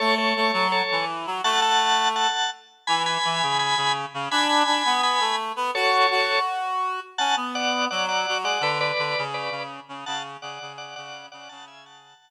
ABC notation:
X:1
M:4/4
L:1/8
Q:1/4=167
K:F#m
V:1 name="Drawbar Organ"
[Ac] [Ac]3 [Ac]2 z2 | [fa] [fa]3 [fa]2 z2 | [gb] [gb]3 [gb]2 z2 | [gb] [gb]3 [gb]2 z2 |
[Ac]4 z4 | [fa] z [df]2 [df] [df]2 [df] | [Bd] [Bd]3 [Bd]2 z2 | [fa] z [df]2 [df] [df]2 [df] |
[fa] [eg] [fa]4 z2 |]
V:2 name="Clarinet"
A,2 A, F,2 E,2 F, | A,5 z3 | E,2 E, C,2 C,2 C, | D2 D B,2 A,2 B, |
F2 F6 | C B,3 F,2 F, G, | D,2 D, C,2 C,2 C, | C,2 C, C,2 C,2 C, |
C,4 z4 |]